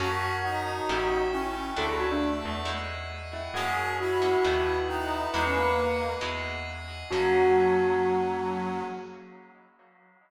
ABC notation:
X:1
M:4/4
L:1/16
Q:1/4=135
K:F#mix
V:1 name="Tubular Bells"
F4 F8 E4 | =A G F =D z10 E2 | F4 F8 E4 | B10 z6 |
F16 |]
V:2 name="Brass Section"
F4 D8 C4 | =A,10 z6 | G4 E8 D4 | D C A,6 z8 |
F,16 |]
V:3 name="Acoustic Guitar (steel)"
[A,CFG]8 [=A,CE=G]8 | [=A,=DEF]8 [G,^DEF]8 | [G,A,CF]6 [G,A,CF]2 [=A,B,DF]8 | [G,DEF]8 [G,DEF]8 |
[A,CFG]16 |]
V:4 name="Electric Bass (finger)" clef=bass
F,,8 =A,,,8 | =D,,6 E,,10 | F,,8 D,,8 | E,,8 E,,8 |
F,,16 |]
V:5 name="Pad 5 (bowed)"
[Acfg]4 [Acga]4 [=Ace=g]4 [Acg=a]4 | [=A=def]4 [Adf=a]4 [G^def]4 [Gdfg]4 | [GAcf]4 [FGAf]4 [=ABdf]4 [ABf=a]4 | [Gdef]4 [Gdfg]4 [Gdef]4 [Gdfg]4 |
[A,CFG]16 |]